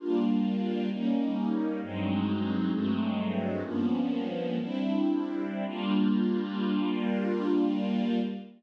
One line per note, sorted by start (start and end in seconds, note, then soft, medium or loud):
0.00 0.90 G3 medium
0.00 0.90 A#3 medium
0.00 0.90 D4 medium
0.00 0.90 F4 medium
0.91 1.81 G3 medium
0.91 1.81 A#3 medium
0.91 1.81 C#4 medium
0.91 1.81 D#4 medium
1.82 2.72 G2 medium
1.82 2.72 F#3 medium
1.82 2.72 G#3 medium
1.82 2.72 C4 medium
1.82 2.72 D#4 medium
2.73 3.63 G2 medium
2.73 3.63 F#3 medium
2.73 3.63 G#3 medium
2.73 3.63 A3 medium
2.73 3.63 C4 medium
3.64 4.58 G2 medium
3.64 4.58 F3 medium
3.64 4.58 A#3 medium
3.64 4.58 B3 medium
3.64 4.58 C#4 medium
4.59 5.65 G3 medium
4.59 5.65 C4 medium
4.59 5.65 D4 medium
4.59 5.65 E4 medium
5.66 8.20 G3 loud
5.66 8.20 A#3 medium
5.66 8.20 D4 medium
5.66 8.20 F4 loud